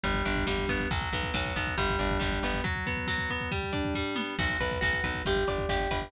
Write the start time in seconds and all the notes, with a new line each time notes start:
0.04 G1 G3, kick, closed hi-hat
0.14 kick
0.25 G1 D4, kick, closed hi-hat
0.36 kick
0.47 G1 G3, kick, snare
0.58 kick
0.68 G1 B3, kick, closed hi-hat
0.80 kick
0.91 B1 F#3, kick, closed hi-hat
1.02 kick
1.13 B1 B3, kick, closed hi-hat
1.23 kick
1.34 B1 F#3, kick, snare
1.45 kick
1.56 B1 B3, kick, closed hi-hat
1.67 kick
1.78 G1 G3, kick, closed hi-hat
1.89 kick
1.99 G1 D4, kick, closed hi-hat
2.10 kick
2.20 G1 G3, kick, snare
2.32 kick
2.42 G1 B3, kick, closed hi-hat
2.54 kick
2.64 F#3, kick, closed hi-hat
2.76 kick
2.86 B3, kick, closed hi-hat
2.97 kick
3.07 F#3, kick, snare
3.18 kick
3.29 B3, kick, closed hi-hat
3.41 kick
3.51 G3, kick, closed hi-hat
3.63 kick
3.73 D4, kick, closed hi-hat
3.85 kick
3.94 G3, kick, floor tom
4.16 B3, high tom
4.39 B1 F#4, kick, crash
4.49 kick
4.60 B1 B4, kick, closed hi-hat
4.71 kick
4.81 B1 F#4, kick, snare
4.93 kick
5.04 B1 B4, kick, closed hi-hat
5.14 kick
5.25 G1 G4, kick, closed hi-hat
5.36 kick
5.47 G1 D5, kick, closed hi-hat
5.58 kick
5.69 G1 G4, kick, snare
5.80 kick
5.90 G1 B4, kick, closed hi-hat
6.02 kick